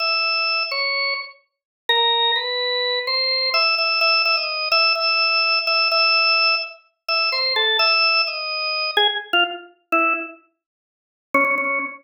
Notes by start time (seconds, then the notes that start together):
0.00 E5
0.71 C#5
1.89 A#4
2.36 B4
3.07 C5
3.54 E5
3.78 E5
4.01 E5
4.25 E5
4.37 D#5
4.72 E5
4.95 E5
5.67 E5
5.92 E5
7.08 E5
7.32 C5
7.56 A4
7.79 E5
8.27 D#5
8.97 G#4
9.33 F4
9.92 E4
11.34 C#4
11.45 C#4
11.58 C#4